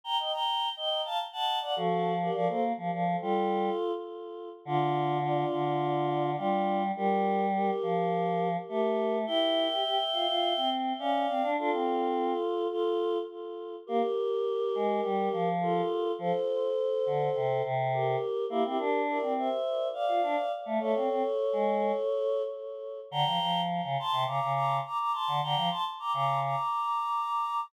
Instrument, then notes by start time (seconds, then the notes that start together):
choir aahs
0.04 G5 A#5
0.19 D#5 G5
0.32 G5 A#5
0.77 D#5 G5
1.05 F5 A5
1.32 F#5 A5
1.61 D5 F#5
1.76 F3 F#4 A4
2.22 G4 A#4
2.34 F3 A#4 D5
2.49 A#3 A4 C5
2.77 F3
2.92 F3
3.21 G3 F4 A4
4.65 D3 D4 F4
5.21 D4 F4
5.52 D3
6.36 G3 D4 F4
6.96 G3 G4 A#4
7.54 G4 A#4
7.82 F3
8.69 A3 G4 A#4
9.27 E4 E5 G5
9.70 G4
9.84 G4
10.13 F4
10.28 F4
10.57 C4
10.99 C#4 D5 F5
11.29 C4
11.43 D4
11.57 D4 F4 A4
11.72 C4
12.71 F4 A4
13.87 A#3 G4 A#4
14.75 G#3
15.04 G3
15.32 F3
15.61 F4 A4
16.19 F3 A4 C5
17.06 D3
17.35 C3
17.63 C3
17.93 G4 A#4
18.50 A#3 E4 G4
18.64 C4 E4 G4
18.78 D4 G4 A#4
19.08 A#4 D5
19.22 C4
19.37 C5 E5
19.93 D5 F5
20.08 F4
20.22 D4
20.66 A3
20.80 A3 A4 C#5
20.95 C4
21.09 C4
21.53 G#3
23.11 D3 G5 A#5
23.26 F3
23.40 F3
23.83 C#3
23.99 A5 C6
24.12 C3
24.26 C#3 A#5 D6
24.41 C#3
24.53 A#5 D6
24.85 A#5 D6
24.99 A#5 D6
25.12 A5 C6
25.28 D3
25.42 D3 G5 A#5
25.56 F3
25.70 A5 C6
25.99 A#5 D6
26.13 C#3 A#5 D6
26.43 A#5 D6